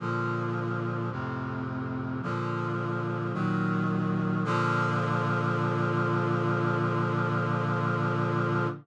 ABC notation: X:1
M:4/4
L:1/8
Q:1/4=54
K:Bb
V:1 name="Brass Section" clef=bass
[B,,D,F,]2 [F,,A,,C,]2 [B,,D,F,]2 [B,,E,_G,]2 | [B,,D,F,]8 |]